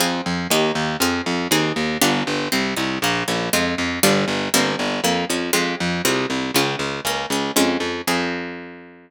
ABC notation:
X:1
M:4/4
L:1/8
Q:1/4=119
K:Fm
V:1 name="Harpsichord"
[CFA]2 [B,EG]2 [CFA]2 [CEA]2 | [=B,=DFG]2 C E _B, _D [A,CF]2 | [G,=B,=DF]2 [G,_B,C=E]2 B, _D [A,CF]2 | [A,CF]2 [A,DF]2 B, D [A,DF]2 |
[CFA]8 |]
V:2 name="Harpsichord" clef=bass
F,, F,, E,, E,, F,, F,, E,, E,, | G,,, G,,, C,, C,, B,,, B,,, F,, F,, | G,,, G,,, G,,, G,,, F,, F,, F,, F,, | C,, C,, D,, D,, D,, D,, F,, F,, |
F,,8 |]